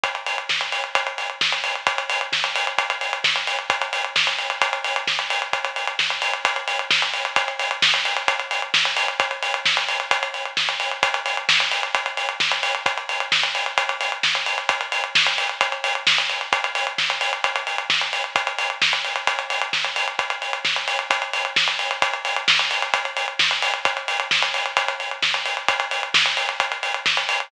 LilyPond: \new DrumStaff \drummode { \time 4/4 \tempo 4 = 131 <hh bd>16 hh16 hho16 hh16 <bd sn>16 hh16 hho16 hh16 <hh bd>16 hh16 hho16 hh16 <bd sn>16 hh16 hho16 hh16 | <hh bd>16 hh16 hho16 hh16 <bd sn>16 hh16 hho16 hh16 <hh bd>16 hh16 hho16 hh16 <bd sn>16 hh16 hho16 hh16 | <hh bd>16 hh16 hho16 hh16 <bd sn>16 hh16 hho16 hh16 <hh bd>16 hh16 hho16 hh16 <bd sn>16 hh16 hho16 hh16 | <hh bd>16 hh16 hho16 hh16 <bd sn>16 hh16 hho16 hh16 <hh bd>16 hh16 hho16 hh16 <bd sn>16 hh16 hho16 hh16 |
<hh bd>16 hh16 hho16 hh16 <bd sn>16 hh16 hho16 hh16 <hh bd>16 hh16 hho16 hh16 <bd sn>16 hh16 hho16 hh16 | <hh bd>16 hh16 hho16 hh16 <bd sn>16 hh16 hho16 hh16 <hh bd>16 hh16 hho16 hh16 <bd sn>16 hh16 hho16 hh16 | <hh bd>16 hh16 hho16 hh16 <bd sn>16 hh16 hho16 hh16 <hh bd>16 hh16 hho16 hh16 <bd sn>16 hh16 hho16 hh16 | <hh bd>16 hh16 hho16 hh16 <bd sn>16 hh16 hho16 hh16 <hh bd>16 hh16 hho16 hh16 <bd sn>16 hh16 hho16 hh16 |
<hh bd>16 hh16 hho16 hh16 <bd sn>16 hh16 hho16 hh16 <hh bd>16 hh16 hho16 hh16 <bd sn>16 hh16 hho16 hh16 | <hh bd>16 hh16 hho16 hh16 <bd sn>16 hh16 hho16 hh16 <hh bd>16 hh16 hho16 hh16 <bd sn>16 hh16 hho16 hh16 | <hh bd>16 hh16 hho16 hh16 <bd sn>16 hh16 hho16 hh16 <hh bd>16 hh16 hho16 hh16 <bd sn>16 hh16 hho16 hh16 | <hh bd>16 hh16 hho16 hh16 <bd sn>16 hh16 hho16 hh16 <hh bd>16 hh16 hho16 hh16 <bd sn>16 hh16 hho16 hh16 |
<hh bd>16 hh16 hho16 hh16 <bd sn>16 hh16 hho16 hh16 <hh bd>16 hh16 hho16 hh16 <bd sn>16 hh16 hho16 hh16 | <hh bd>16 hh16 hho16 hh16 <bd sn>16 hh16 hho16 hh16 <hh bd>16 hh16 hho16 hh16 <bd sn>16 hh16 hho16 hh16 | <hh bd>16 hh16 hho16 hh16 <bd sn>16 hh16 hho16 hh16 <hh bd>16 hh16 hho16 hh16 <bd sn>16 hh16 hho16 hh16 | }